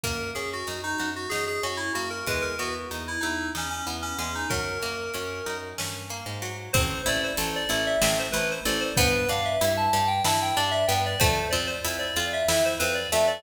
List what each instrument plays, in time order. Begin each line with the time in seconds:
0.03 electric bass (finger) F#2, pizzicato strings A#3, electric piano 2 A#4, kick, closed hi-hat
0.35 electric bass (finger) F#2, pizzicato strings C#4, electric piano 2 G#4, closed hi-hat
0.53 electric piano 2 F#4
0.67 electric bass (finger) F#2, pizzicato strings D#4, closed hi-hat
0.83 electric piano 2 D#4
0.98 electric bass (finger) F#2, pizzicato strings F#4, closed hi-hat
1.16 electric piano 2 F#4
1.29 electric bass (finger) F#2, pizzicato strings D#4, electric piano 2 G#4, snare
1.47 electric piano 2 G#4
1.63 electric bass (finger) F#2, pizzicato strings C#4, electric piano 2 F#4, closed hi-hat
1.77 electric piano 2 E4
1.94 electric bass (finger) F#2, pizzicato strings A#3, electric piano 2 F#4, closed hi-hat
2.10 electric piano 2 A#4
2.27 electric bass (finger) E2, pizzicato strings G#3, electric piano 2 B4, kick, closed hi-hat
2.42 electric piano 2 A#4
2.59 electric bass (finger) E2, pizzicato strings B3, electric piano 2 F#4, closed hi-hat
2.91 electric bass (finger) E2, pizzicato strings D#4, closed hi-hat
3.08 electric piano 2 E4
3.20 electric bass (finger) E2, electric piano 2 D#4, pizzicato strings E4, closed hi-hat
3.55 electric bass (finger) E2, electric piano 2 C#4, pizzicato strings D#4, snare
3.70 electric piano 2 C#4
3.87 electric bass (finger) E2, pizzicato strings B3, closed hi-hat
4.02 electric piano 2 C#4
4.18 electric bass (finger) E2, pizzicato strings G#3, electric piano 2 C#4, closed hi-hat
4.35 electric piano 2 D#4
4.49 electric bass (finger) F#2, pizzicato strings F#3, electric piano 2 A#4, kick, closed hi-hat
4.82 electric bass (finger) F#2, pizzicato strings A#3, closed hi-hat
5.14 electric bass (finger) F#2, pizzicato strings C#4, closed hi-hat
5.46 electric bass (finger) F#2, pizzicato strings D#4, closed hi-hat
5.78 electric bass (finger) G2, pizzicato strings C#4, snare
6.10 pizzicato strings A#3, closed hi-hat
6.26 electric bass (finger) G#2
6.42 pizzicato strings F#3, closed hi-hat
6.73 electric bass (finger) A1, pizzicato strings C4, electric piano 2 C5, kick, closed hi-hat
7.06 electric bass (finger) A1, pizzicato strings E4, electric piano 2 D5, closed hi-hat
7.24 electric piano 2 C5
7.37 electric bass (finger) A1, pizzicato strings A4, closed hi-hat
7.56 electric piano 2 D5
7.69 electric bass (finger) A1, pizzicato strings E4, closed hi-hat
7.87 electric piano 2 E5
8.02 electric bass (finger) A1, pizzicato strings C4, electric piano 2 E5, snare
8.19 electric piano 2 C5
8.32 electric bass (finger) A1, pizzicato strings E4, electric piano 2 B4, closed hi-hat
8.51 electric piano 2 C5
8.65 electric bass (finger) A1, pizzicato strings A4, electric piano 2 D5, closed hi-hat
8.80 electric piano 2 C5
8.97 electric bass (finger) G2, pizzicato strings B3, electric piano 2 B4, kick, closed hi-hat
9.29 electric bass (finger) G2, pizzicato strings D4, electric piano 2 F5, closed hi-hat
9.45 electric piano 2 E5
9.61 electric bass (finger) G2, pizzicato strings E4, closed hi-hat
9.77 electric piano 2 A5
9.93 electric bass (finger) G2, pizzicato strings G4, closed hi-hat
10.08 electric piano 2 G5
10.24 electric bass (finger) G2, pizzicato strings E4, electric piano 2 A5, snare
10.42 electric piano 2 G5
10.57 electric bass (finger) G2, pizzicato strings D4, electric piano 2 D5, closed hi-hat
10.71 electric piano 2 E5
10.88 electric bass (finger) G2, pizzicato strings B3, electric piano 2 G5, closed hi-hat
11.06 electric piano 2 D5
11.19 electric bass (finger) F2, pizzicato strings A3, electric piano 2 C5, kick, closed hi-hat
11.51 electric bass (finger) F2, pizzicato strings C4, electric piano 2 D5, closed hi-hat
11.67 electric piano 2 C5
11.85 electric bass (finger) F2, pizzicato strings E4, closed hi-hat
11.99 electric piano 2 D5
12.16 electric bass (finger) F2, pizzicato strings F4, closed hi-hat
12.33 electric piano 2 E5
12.48 electric bass (finger) F2, pizzicato strings E4, electric piano 2 E5, snare
12.65 electric piano 2 C5
12.79 electric bass (finger) F2, pizzicato strings C4, electric piano 2 B4, closed hi-hat
12.94 electric piano 2 D5
13.12 electric bass (finger) F2, pizzicato strings A3, electric piano 2 E5, closed hi-hat
13.27 electric piano 2 D5